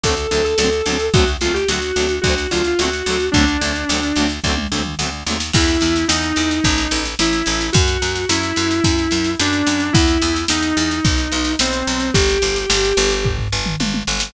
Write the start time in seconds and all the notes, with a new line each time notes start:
0.03 D2 D3 F#3 A3 A4, kick, snare
0.09 C4
0.17 snare
0.31 D2 D3 F#3 A3 A4, snare
0.37 C4
0.45 A4, snare
0.58 D2 D3 F#3 A4, snare
0.62 A3 C4
0.73 snare
0.86 D2 D3 F#3, snare
0.90 A3 C4
0.99 snare
1.14 D2 D3 F#3 A3 F#4, kick, snare
1.19 C4
1.27 snare
1.41 D2 D3 F#3 F4, snare
1.45 A3 C4
1.54 G4, snare
1.68 D2 D3 F#3 F#4, snare
1.72 A3 C4
1.82 snare
1.96 D2 D3 F#3, snare
2.00 A3 C4
2.09 snare
2.22 D2 D3 F#4, kick, snare
2.26 F#3 A3 C4
2.38 snare
2.51 D2 D3 F#3 F4, snare
2.55 A3 C4
2.64 F4, snare
2.79 D2 D3 F#3 A3 F#4, snare
2.84 C4
2.93 snare
3.06 D2 D3 F#3, snare
3.10 A3 C4
3.20 snare
3.32 D2 D3 D4, kick, snare
3.36 F#3 A3 C4
3.48 snare
3.61 D2 D3 F#3 A3, snare
3.67 C4
3.75 snare
3.89 D2 D3 F#3 A3, snare
3.95 C4
4.03 snare
4.15 D2 D3 F#3, snare
4.20 A3 C4
4.29 snare
4.44 D2 D3 F#3, kick, snare
4.48 A3 C4
4.57 high tom
4.72 D2 D3 F#3 A3, snare
4.77 C4
4.84 mid tom
4.99 D2 D3 F#3, snare
5.03 A3 C4
5.26 D#2 D3 F#3 A3, snare
5.32 C4
5.40 snare
5.53 E2 E4, kick, snare, crash
5.68 snare
5.81 E2, snare
5.96 snare
6.08 E2 D#4, snare
6.22 snare
6.36 E2, snare
6.51 snare
6.64 A1, kick, snare
6.78 snare
6.91 A1, snare
7.05 snare
7.19 A1 E4, snare
7.33 snare
7.46 A1, snare
7.61 snare
7.72 F#2 F#4, kick, snare
7.88 snare
8.02 F#2, snare
8.15 snare
8.29 F#2 E4, snare
8.43 snare
8.56 F#2, snare
8.71 snare
8.84 F#2, kick, snare
8.98 snare
9.11 F#2, snare
9.24 snare
9.39 F#2 D4, snare
9.53 snare
9.67 F#2, snare
9.80 snare
9.93 E2 E4, kick, snare
10.08 snare
10.22 E2, snare
10.36 snare
10.48 E2 D#4, snare
10.62 snare
10.77 E2, snare
10.91 snare
11.04 B1, kick, snare
11.18 snare
11.32 B1, snare
11.45 snare
11.59 B1 C4, snare
11.73 snare
11.87 B1, snare
12.00 snare
12.14 G1 G4, kick, snare
12.29 snare
12.42 G1, snare
12.56 snare
12.70 G1, snare
12.84 snare
12.97 G1, snare
13.10 snare
13.25 kick, floor tom
13.38 floor tom
13.52 G1
13.66 mid tom
13.80 G1, high tom
13.94 high tom
14.07 G1, snare
14.20 snare